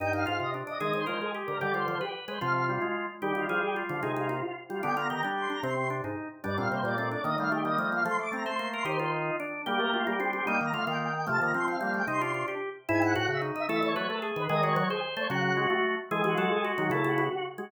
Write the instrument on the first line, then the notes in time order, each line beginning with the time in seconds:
drawbar organ
0.00 G2 D#4 G5
0.13 D#4 F5
0.26 G#2 F4 F5
0.40 C3 D#5
0.54 D4
0.67 D4 D#5
0.80 D#3 G#3 G#4 D#5
0.93 D#3 C5
1.06 F3 G#3 A#4 C5
1.21 G#3 G#4
1.35 G4
1.47 D3 A#4
1.60 D3 G3 G4 D5
1.74 G3 F4 C5
1.88 F3 C5
2.01 G4 B4
2.28 G#3 B4 C5
2.41 C3 F3 F4 F5
2.68 G3 F4
2.82 G#3
3.22 D#3 G3 G4
3.35 D#3 F4
3.49 F3 F4 G#4
3.62 G4
3.76 F4
3.89 D3 F3 F4
4.03 C3 G#3 D#4 G#4
4.16 G#3 F4
4.29 A#3 F4
4.43 F4
4.69 G3 F4
4.83 D3 B3 D4 G5
4.96 B3 F4 A#5
5.10 D#3 G4 A#5
5.23 G3 D4 G4
5.37 C6
5.50 D4 A#5
5.63 C3 C4 C6
5.90 D4
6.04 G#2 D#4
6.44 G2 G3 D4 D5
6.57 A#2 C4 F5
6.71 C3 A#3 C5
6.83 A#2 A#3 D5
6.98 A3 C4
7.11 D4 D5
7.24 D#3 A#3 D#5
7.38 G3 A3 F5
7.51 A3 G4
7.65 G3 A#3 D#5
7.78 F3 A3
7.91 A#3 F5
8.05 F3 A3 C6
8.19 A3 D6
8.32 A3 C4 A#5
8.45 A3 C5 C6
8.59 A#3
8.73 A#4 C6
8.85 D#3 D#4 G4 C5
8.99 F4 C5
9.40 D4
9.66 G3 A#3 G4
9.79 A3 A#4
9.94 A3 F4
10.07 G3 A#3 G4
10.20 C4 D4
10.33 C4 G4
10.47 G3 A#3 D#4 G5
10.61 D#3 A#5
10.73 D3 A3 F4 F5
10.87 D#3 A#3 F4 G5
11.15 G5
11.27 C3 F3 A3 A5
11.40 D#3 A#3 A#5
11.54 F3 C4 C6
11.67 F3 C4 F5
11.81 G3 A#3
11.94 A3 G5
12.07 C3 D#4 C6
12.21 D4 F4
12.34 F4
12.48 G4
12.88 G#2 E4 G#5
13.02 E4 F#5
13.15 A2 F#4 F#5
13.28 C#3 E5
13.42 D#4
13.55 D#4 E5
13.69 E3 A3 A4 E5
13.83 E3 C#5
13.95 F#3 A3 B4 C#5
14.09 A3 A4
14.22 G#4
14.36 D#3 B4
14.49 D#3 G#3 G#4 D#5
14.63 G#3 F#4 C#5
14.76 F#3 C#5
14.90 G#4 C5
15.17 A3 C5 C#5
15.29 C#3 F#3 F#4 F#5
15.57 G#3 F#4
15.70 A3
16.11 E3 G#3 G#4
16.24 E3 F#4
16.38 F#3 F#4 A4
16.51 G#4
16.64 F#4
16.78 D#3 F#3 F#4
16.90 C#3 A3 E4 A4
17.04 A3 F#4
17.18 B3 F#4
17.31 F#4
17.58 G#3 F#4